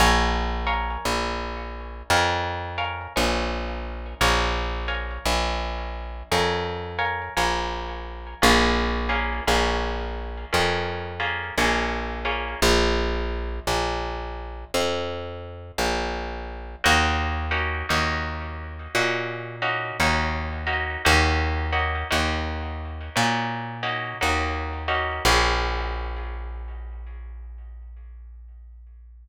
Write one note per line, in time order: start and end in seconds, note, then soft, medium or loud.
0.00 0.97 A#1 loud
0.00 0.62 A#4 loud
0.00 0.62 C#5 loud
0.00 0.62 F5 loud
0.00 0.62 G#5 loud
0.67 2.01 A#4 medium
0.67 2.01 C#5 medium
0.67 2.01 F5 loud
0.67 2.01 G#5 medium
1.05 2.03 A#1 medium
2.10 3.08 F2 medium
2.10 2.72 A#4 loud
2.10 2.72 C#5 medium
2.10 2.72 F5 loud
2.10 2.72 G#5 medium
2.78 3.13 A#4 loud
2.78 3.13 C#5 medium
2.78 3.13 F5 medium
2.78 3.13 G#5 medium
3.16 4.14 A#1 medium
3.16 4.15 A#4 loud
3.16 4.15 C#5 medium
3.16 4.15 F5 medium
3.16 4.15 G#5 medium
4.21 5.19 A#1 loud
4.21 4.82 A#4 loud
4.21 4.82 C#5 loud
4.21 4.82 F5 loud
4.21 4.82 G#5 loud
4.88 6.22 A#4 medium
4.88 6.22 C#5 medium
4.88 6.22 F5 loud
4.88 6.22 G#5 medium
5.25 6.23 A#1 medium
6.32 7.29 F2 medium
6.32 6.93 A#4 loud
6.32 6.93 C#5 medium
6.32 6.93 F5 medium
6.32 6.93 G#5 medium
6.99 7.34 A#4 medium
6.99 7.34 C#5 medium
6.99 7.34 F5 medium
6.99 7.34 G#5 medium
7.37 8.35 A#1 medium
7.37 8.36 A#4 medium
7.37 8.36 C#5 medium
7.37 8.36 F5 medium
7.37 8.36 G#5 loud
8.42 9.41 A#1 loud
8.42 9.04 A#3 loud
8.42 9.04 C#4 loud
8.42 9.04 F4 loud
8.42 9.04 G#4 loud
9.09 9.44 A#3 loud
9.09 9.44 C#4 medium
9.09 9.44 F4 medium
9.09 9.44 G#4 medium
9.47 10.45 A#1 medium
9.47 10.46 A#3 medium
9.47 10.46 C#4 loud
9.47 10.46 F4 medium
9.47 10.46 G#4 medium
10.53 11.52 F2 medium
10.53 11.14 A#3 medium
10.53 11.14 C#4 medium
10.53 11.14 F4 medium
10.53 11.14 G#4 medium
11.20 11.55 A#3 medium
11.20 11.55 C#4 medium
11.20 11.55 F4 medium
11.20 11.55 G#4 medium
11.58 12.55 A#1 medium
11.58 12.20 A#3 loud
11.58 12.20 C#4 medium
11.58 12.20 F4 medium
11.58 12.20 G#4 medium
12.25 12.60 A#3 medium
12.25 12.60 C#4 medium
12.25 12.60 F4 loud
12.25 12.60 G#4 medium
12.62 13.60 A#1 loud
13.67 14.65 A#1 medium
14.74 15.72 F2 medium
15.78 16.76 A#1 medium
16.84 17.83 D#2 loud
16.84 17.46 A#3 loud
16.84 17.46 C#4 loud
16.84 17.46 D#4 loud
16.84 17.46 F#4 loud
17.51 17.86 A#3 medium
17.51 17.86 C#4 loud
17.51 17.86 D#4 medium
17.51 17.86 F#4 medium
17.89 18.88 D#2 medium
17.89 18.88 A#3 medium
17.89 18.88 C#4 medium
17.89 18.88 D#4 medium
17.89 18.88 F#4 medium
18.95 19.92 A#2 medium
18.95 19.57 A#3 loud
18.95 19.57 C#4 medium
18.95 19.57 D#4 medium
18.95 19.57 F#4 loud
19.62 19.97 A#3 loud
19.62 19.97 C#4 medium
19.62 19.97 D#4 medium
19.62 19.97 F#4 medium
20.00 20.97 D#2 medium
20.00 20.62 A#3 medium
20.00 20.62 C#4 medium
20.00 20.62 D#4 medium
20.00 20.62 F#4 medium
20.67 21.02 A#3 medium
20.67 21.02 C#4 medium
20.67 21.02 D#4 medium
20.67 21.02 F#4 medium
21.05 22.04 D#2 loud
21.05 21.66 A#3 loud
21.05 21.66 C#4 loud
21.05 21.66 D#4 loud
21.05 21.66 F#4 loud
21.73 22.08 A#3 medium
21.73 22.08 C#4 medium
21.73 22.08 D#4 medium
21.73 22.08 F#4 medium
22.11 23.10 D#2 medium
22.11 23.10 A#3 loud
22.11 23.10 C#4 loud
22.11 23.10 D#4 loud
22.11 23.10 F#4 loud
23.16 24.14 A#2 medium
23.16 23.77 A#3 medium
23.16 23.77 C#4 loud
23.16 23.77 D#4 medium
23.16 23.77 F#4 medium
23.83 24.18 A#3 medium
23.83 24.18 C#4 loud
23.83 24.18 D#4 medium
23.83 24.18 F#4 medium
24.21 25.20 D#2 medium
24.21 24.83 A#3 medium
24.21 24.83 C#4 medium
24.21 24.83 D#4 medium
24.21 24.83 F#4 medium
24.88 25.23 A#3 medium
24.88 25.23 C#4 loud
24.88 25.23 D#4 loud
24.88 25.23 F#4 medium
25.25 29.28 A#1 loud
25.25 29.28 A#3 loud
25.25 29.28 C#4 loud
25.25 29.28 F4 medium
25.25 29.28 G#4 loud